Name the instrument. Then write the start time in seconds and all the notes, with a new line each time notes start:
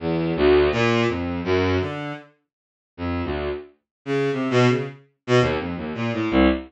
violin
0.00 E2
0.36 D2
0.72 A#2
1.08 F2
1.44 F#2
1.80 D3
2.97 F2
3.24 D2
4.05 C#3
4.32 C3
4.50 B2
4.68 C#3
5.27 B2
5.41 D#2
5.59 F2
5.77 D#2
5.95 A#2
6.13 A2
6.31 C2